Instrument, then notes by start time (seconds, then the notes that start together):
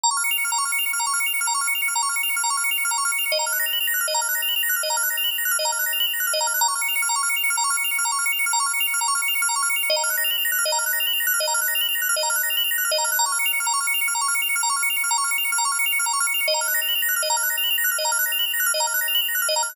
drawbar organ
0.03 A#5
0.11 C#6
0.17 F6
0.24 C#7
0.31 F7
0.38 C#7
0.44 F6
0.52 A#5
0.58 C#6
0.65 F6
0.72 C#7
0.79 F7
0.86 C#7
0.93 F6
0.99 A#5
1.07 C#6
1.13 F6
1.20 C#7
1.26 F7
1.34 C#7
1.41 F6
1.47 A#5
1.54 C#6
1.61 F6
1.67 C#7
1.75 F7
1.82 C#7
1.88 F6
1.95 A#5
2.03 C#6
2.09 F6
2.16 C#7
2.23 F7
2.29 C#7
2.36 F6
2.43 A#5
2.50 C#6
2.57 F6
2.64 C#7
2.71 F7
2.78 C#7
2.85 F6
2.91 A#5
2.98 C#6
3.05 F6
3.12 C#7
3.18 F7
3.26 C#7
3.32 D#5
3.39 A#5
3.46 F6
3.52 F#6
3.59 A#6
3.66 F7
3.73 F#7
3.80 F7
3.87 A#6
3.94 F#6
4.01 F6
4.08 D#5
4.14 A#5
4.21 F6
4.29 F#6
4.35 A#6
4.42 F7
4.48 F#7
4.56 F7
4.63 A#6
4.69 F#6
4.76 F6
4.83 D#5
4.90 A#5
4.97 F6
5.03 F#6
5.10 A#6
5.17 F7
5.24 F#7
5.31 F7
5.38 A#6
5.45 F#6
5.51 F6
5.59 D#5
5.65 A#5
5.72 F6
5.79 F#6
5.86 A#6
5.93 F7
6.00 F#7
6.07 F7
6.13 A#6
6.20 F#6
6.27 F6
6.33 D#5
6.41 A#5
6.47 F6
6.54 F#6
6.61 A#5
6.68 C#6
6.75 F6
6.81 C#7
6.88 F7
6.95 C#7
7.02 F6
7.09 A#5
7.16 C#6
7.23 F6
7.29 C#7
7.36 F7
7.43 C#7
7.50 F6
7.57 A#5
7.64 C#6
7.70 F6
7.77 C#7
7.84 F7
7.91 C#7
7.98 F6
8.05 A#5
8.12 C#6
8.19 F6
8.26 C#7
8.32 F7
8.39 C#7
8.46 F6
8.53 A#5
8.60 C#6
8.66 F6
8.73 C#7
8.80 F7
8.87 C#7
8.94 F6
9.01 A#5
9.08 C#6
9.15 F6
9.22 C#7
9.28 F7
9.35 C#7
9.42 F6
9.49 A#5
9.56 C#6
9.62 F6
9.69 C#7
9.76 F7
9.83 C#7
9.90 D#5
9.96 A#5
10.03 F6
10.10 F#6
10.17 A#6
10.24 F7
10.31 F#7
10.38 F7
10.45 A#6
10.52 F#6
10.58 F6
10.65 D#5
10.72 A#5
10.78 F6
10.86 F#6
10.93 A#6
11.00 F7
11.07 F#7
11.13 F7
11.20 A#6
11.27 F#6
11.34 F6
11.40 D#5
11.47 A#5
11.54 F6
11.61 F#6
11.68 A#6
11.75 F7
11.81 F#7
11.88 F7
11.95 A#6
12.02 F#6
12.09 F6
12.16 D#5
12.23 A#5
12.30 F6
12.36 F#6
12.43 A#6
12.50 F7
12.57 F#7
12.64 F7
12.71 A#6
12.78 F#6
12.85 F6
12.91 D#5
12.98 A#5
13.04 F6
13.12 F#6
13.19 A#5
13.26 C#6
13.32 F6
13.39 C#7
13.46 F7
13.53 C#7
13.60 F6
13.66 A#5
13.73 C#6
13.80 F6
13.87 C#7
13.94 F7
14.01 C#7
14.08 F6
14.15 A#5
14.21 C#6
14.28 F6
14.35 C#7
14.42 F7
14.49 C#7
14.56 F6
14.63 A#5
14.70 C#6
14.76 F6
14.83 C#7
14.90 F7
14.96 C#7
15.04 F6
15.11 A#5
15.18 C#6
15.24 F6
15.31 C#7
15.38 F7
15.45 C#7
15.52 F6
15.58 A#5
15.65 C#6
15.72 F6
15.79 C#7
15.86 F7
15.92 C#7
15.99 F6
16.06 A#5
16.13 C#6
16.20 F6
16.27 C#7
16.34 F7
16.41 C#7
16.48 D#5
16.54 A#5
16.61 F6
16.68 F#6
16.74 A#6
16.82 F7
16.88 F#7
16.95 F7
17.02 A#6
17.09 F#6
17.16 F6
17.22 D#5
17.30 A#5
17.37 F6
17.43 F#6
17.50 A#6
17.57 F7
17.64 F#7
17.70 F7
17.78 A#6
17.84 F#6
17.91 F6
17.98 D#5
18.05 A#5
18.12 F6
18.19 F#6
18.26 A#6
18.32 F7
18.39 F#7
18.46 F7
18.53 A#6
18.60 F#6
18.66 F6
18.74 D#5
18.80 A#5
18.87 F6
18.94 F#6
19.01 A#6
19.08 F7
19.15 F#7
19.21 F7
19.28 A#6
19.35 F#6
19.42 F6
19.49 D#5
19.56 A#5
19.63 F6
19.69 F#6